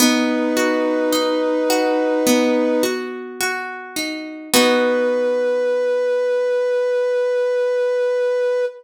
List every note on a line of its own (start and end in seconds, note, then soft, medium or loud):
0.00 2.26 B3 loud
0.00 2.84 D#4 medium
0.00 2.84 B4 medium
0.57 1.69 F#4 medium
1.12 3.96 D#4 medium
1.70 2.83 F#4 medium
2.27 4.42 B3 medium
2.83 3.40 F#4 medium
3.41 4.48 F#4 medium
3.96 4.50 D#4 medium
4.53 8.66 B3 loud
4.53 8.66 D#4 medium
4.53 8.66 F#4 loud
4.53 8.65 B4 loud